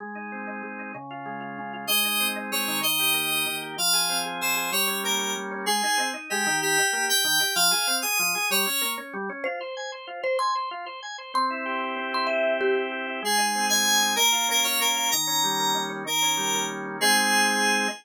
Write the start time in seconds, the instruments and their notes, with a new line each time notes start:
0.00 drawbar organ G#3
0.15 drawbar organ D#4
0.32 drawbar organ C4
0.47 drawbar organ D#4
0.63 drawbar organ G#3
0.79 drawbar organ D#4
0.94 drawbar organ C#3
1.11 drawbar organ F4
1.26 drawbar organ G#3
1.41 drawbar organ F4
1.58 drawbar organ C#3
1.73 drawbar organ F4
1.87 drawbar organ G#3, electric piano 2 D#5
2.05 drawbar organ D#4
2.20 drawbar organ C4
2.36 drawbar organ D#4
2.51 drawbar organ G#3, electric piano 2 C#5
2.68 drawbar organ D#3
2.83 electric piano 2 D#5
2.99 drawbar organ G4
3.14 drawbar organ A#3
3.31 drawbar organ G4
3.46 drawbar organ D#3
3.62 drawbar organ G4
3.78 drawbar organ F3, electric piano 2 F5
3.93 drawbar organ G#4
4.09 drawbar organ C4
4.25 drawbar organ G#4
4.41 drawbar organ F3, electric piano 2 C5
4.56 drawbar organ G#4
4.72 drawbar organ G3, electric piano 2 C#5
4.87 drawbar organ C#4
5.04 drawbar organ A#3, electric piano 2 A#4
5.19 drawbar organ C#4
5.36 drawbar organ G3
5.51 drawbar organ C#4
5.66 drawbar organ G#3, electric piano 2 G#4
5.83 drawbar organ D#4
5.98 drawbar organ C4
6.14 drawbar organ D#4
6.30 drawbar organ G#3, electric piano 2 G4
6.47 drawbar organ D#3
6.62 electric piano 2 G4
6.77 drawbar organ G4
6.93 drawbar organ A#3
7.08 drawbar organ G4, electric piano 2 G5
7.24 drawbar organ D#3
7.40 drawbar organ G4
7.55 drawbar organ F3, electric piano 2 F5
7.71 drawbar organ G#4
7.87 drawbar organ C4
8.02 drawbar organ G#4, electric piano 2 D#6
8.19 drawbar organ F3
8.35 drawbar organ G#4
8.50 drawbar organ G3, electric piano 2 C#5
8.66 drawbar organ C#4
8.81 drawbar organ A#3
8.98 drawbar organ C#4
9.13 drawbar organ G3
9.29 drawbar organ C#4
9.44 drawbar organ F4, marimba C5
9.61 drawbar organ C5
9.77 drawbar organ G#5
9.92 drawbar organ C5
10.07 drawbar organ F4
10.23 drawbar organ C5, marimba C5
10.39 drawbar organ G#5, marimba C6
10.55 drawbar organ C5
10.71 drawbar organ F4
10.86 drawbar organ C5
11.03 drawbar organ G#5
11.18 drawbar organ C5
11.34 drawbar organ C4, marimba C6
11.50 drawbar organ E4
11.66 drawbar organ G4
11.81 drawbar organ E4
11.96 drawbar organ C4
12.13 drawbar organ E4, marimba C6
12.27 drawbar organ G4, marimba E5
12.44 drawbar organ E4
12.61 drawbar organ C4, marimba G4
12.76 drawbar organ E4
12.92 drawbar organ G4
13.07 drawbar organ E4
13.22 drawbar organ G#3, electric piano 2 G#4
13.38 drawbar organ D#4
13.55 drawbar organ C4
13.69 drawbar organ D#4, electric piano 2 G#5
13.86 drawbar organ G#3
14.02 drawbar organ D#4
14.16 drawbar organ A#3, electric piano 2 A#4
14.32 drawbar organ F4
14.49 drawbar organ C#4, electric piano 2 A#4
14.64 drawbar organ F4, electric piano 2 C#5
14.80 drawbar organ A#3, electric piano 2 A#4
14.96 drawbar organ F4
15.11 drawbar organ D#3, electric piano 2 A#5
15.27 drawbar organ C#4
15.44 drawbar organ G3
15.59 drawbar organ A#3
15.75 drawbar organ D#3
15.90 drawbar organ C#4
16.06 drawbar organ D#3, electric piano 2 A#4
16.22 drawbar organ C#4
16.37 drawbar organ G3
16.55 drawbar organ A#3
16.70 drawbar organ D#3
16.86 drawbar organ C#4
17.01 drawbar organ G#3 C4 D#4, electric piano 2 G#4